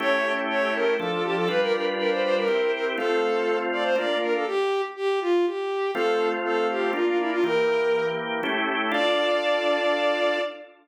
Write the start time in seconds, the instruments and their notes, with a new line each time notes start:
0.00 drawbar organ A3 C#4 E4 G4, violin C#5
0.50 violin C#5
0.74 violin A#4
0.99 drawbar organ F3 D4 A4, violin A4
1.11 violin A4
1.24 violin G4
1.36 violin A4
1.48 drawbar organ G3 D4 F4 B4, violin B4
1.61 violin A#4
1.73 violin A#4
1.98 violin A#4
2.10 violin C5
2.23 violin C5
2.36 violin A#4
2.48 drawbar organ C4 E4 G4
2.73 violin A#4
2.97 drawbar organ A3 C4 F4, violin A4
3.72 violin D5
3.84 violin C5
3.96 drawbar organ A#3 D4 F4, violin D5
4.21 violin A#4
4.34 violin A4
4.47 violin G4
4.96 violin G4
5.21 violin F4
5.46 violin G4
5.95 drawbar organ A3 C4 F4, violin A4
6.45 violin A4
6.70 violin G4
6.93 drawbar organ A#3 D4 F4, violin F4
7.06 violin F4
7.19 violin E4
7.31 violin F4
7.44 drawbar organ E3 A#3 G4, violin A#4
8.43 drawbar organ A3 C#4 E4 G4
8.92 drawbar organ D4 F4 A4, violin D5